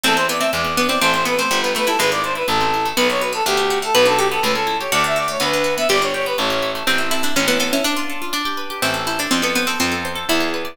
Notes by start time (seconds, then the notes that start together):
0.04 E2 A3 C4 A4
0.16 C4 C5
0.29 B3 E4 D5
0.39 A3 C4 E5
0.53 E2 G#3 D5
0.64 B3
0.77 B3 D4
0.89 C4 E4 D5
1.00 A1 A3 C4 C5
1.13 C4 C5
1.25 B3 E4 B4
1.37 A3 C4 C5
1.51 G1 G3
1.62 B3 B4
1.75 A3 D4 B4
1.86 G3 E4 A4
1.99 G#1 G#3 B4
2.11 B3 D5
2.24 D4 C5
2.35 E4 B4
2.47 A1 A3 A4
2.61 C4
2.74 E4
2.85 A3
2.97 B1 B3 B4
3.10 D4 C#5
3.21 F#4 B4
3.33 B3 A4
3.45 D2 A3 G4
3.57 D4
3.70 F#4
3.82 A3 A4
3.95 B1 B3 B4
4.05 D4 A4
4.17 F#4 G4 A4
4.32 B3 A4
4.43 C#2 A3 B4
4.54 C#4 A4
4.67 E4
4.80 G4 C#5
4.92 D2 A3 F#4 D5
5.04 D4 E5
5.16 F#4 D5
5.28 A3 C#5
5.40 D2 B3 B4
5.54 D4
5.64 F#4
5.78 B3 E5
5.89 G1 B3 G4 D5
6.01 D4 C#5
6.14 G4 C#5
6.26 B3 B4
6.38 A1 A3 C#5
6.50 C#4
6.62 E4
6.75 A3
6.87 A1 C4
6.98 E4
7.11 E4 A4
7.23 D4 E4
7.36 A1 C#4
7.48 B3 E4
7.60 B3 A4
7.73 C#4 E4
7.84 D4
7.97 F4
8.10 A4
8.22 F4
8.33 D4
8.45 G4
8.57 B4
8.70 G4
8.82 A1 C4 E4
8.94 A4
9.07 E4 C5
9.19 D4 A4
9.31 F2 C4 F4
9.42 B3 A4
9.55 B3 C5
9.67 C4 A4
9.80 F2 C4 F4
9.92 A4
10.05 C5
10.15 A4
10.29 E2 E4
10.40 G#4
10.54 B4
10.65 D5